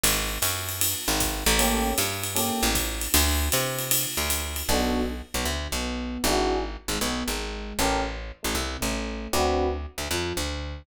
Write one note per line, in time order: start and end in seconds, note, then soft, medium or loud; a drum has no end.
0.03 0.38 G#1 loud
0.03 ride loud
0.42 0.95 F#2 medium
0.42 hi-hat pedal medium
0.42 ride medium
0.69 ride medium
0.81 ride loud
1.08 1.44 G#1 loud
1.20 kick medium
1.20 hi-hat pedal medium
1.20 ride medium
1.46 1.94 A1 loud
1.46 ride medium
1.59 1.90 A#3 medium
1.59 1.90 C#4 medium
1.59 1.90 G4 medium
1.59 1.90 A4 medium
1.59 ride loud
1.98 2.51 G2 medium
1.98 hi-hat pedal medium
1.98 ride medium
2.23 ride medium
2.35 2.66 A#3 medium
2.35 2.66 C#4 medium
2.35 2.66 G4 medium
2.35 2.66 A4 medium
2.35 ride medium
2.63 3.08 A1 loud
2.75 kick medium
2.75 hi-hat pedal medium
2.75 ride medium
3.01 ride medium
3.14 3.49 D2 loud
3.14 ride loud
3.52 4.06 C3 loud
3.52 hi-hat pedal medium
3.52 ride medium
3.79 ride medium
3.91 ride loud
4.17 4.63 D2 medium
4.30 hi-hat pedal medium
4.30 ride medium
4.56 ride medium
4.69 5.22 B1 medium
4.69 5.00 B3 medium
4.69 5.00 D4 loud
4.69 5.00 F#4 medium
4.69 5.00 A4 medium
5.34 5.45 B1 medium
5.34 5.45 B3 medium
5.45 5.68 D2 medium
5.45 5.68 D3 medium
5.72 6.18 B1 medium
5.72 6.18 B3 medium
6.24 6.77 G#1 medium
6.24 6.55 D4 medium
6.24 6.55 E4 medium
6.24 6.55 F#4 medium
6.24 6.55 G#4 medium
6.88 6.99 G#1 medium
6.88 7.00 G#3 medium
7.01 7.23 B1 medium
7.01 7.23 B3 medium
7.28 7.73 G#1 medium
7.28 7.73 G#3 medium
7.79 8.32 A1 medium
7.79 7.97 C#4 medium
7.79 7.97 G4 medium
7.79 7.97 A4 medium
7.79 7.97 A#4 loud
8.43 8.55 A1 medium
8.43 8.54 A3 medium
8.55 8.77 C2 medium
8.55 8.78 C3 medium
8.81 9.28 A1 medium
8.81 9.26 A3 medium
9.33 9.86 D2 medium
9.33 9.64 C4 loud
9.33 9.64 D4 medium
9.33 9.64 F#4 loud
9.33 9.64 B4 medium
9.98 10.08 D2 medium
9.98 10.08 D3 medium
10.11 10.33 F2 medium
10.11 10.34 F3 medium
10.37 10.83 D2 medium
10.37 10.82 D3 medium